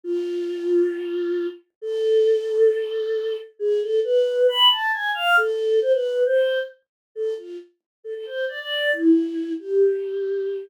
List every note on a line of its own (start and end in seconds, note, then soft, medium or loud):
0.04 1.47 F4 loud
1.82 3.37 A4 loud
3.59 3.80 G#4 loud
3.81 4.00 A4 loud
4.04 4.47 B4 loud
4.48 4.69 B5 loud
4.70 4.91 A5 loud
4.93 5.11 G#5 loud
5.15 5.36 F5 loud
5.37 5.80 A4 loud
5.81 5.92 C5 loud
5.93 6.23 B4 loud
6.26 6.59 C5 loud
7.15 7.34 A4 loud
7.37 7.57 F4 medium
8.04 8.14 A4 medium
8.15 8.25 A4 loud
8.26 8.45 C5 medium
8.48 8.59 D5 medium
8.59 8.91 D5 loud
8.93 9.53 E4 loud
9.59 10.65 G4 medium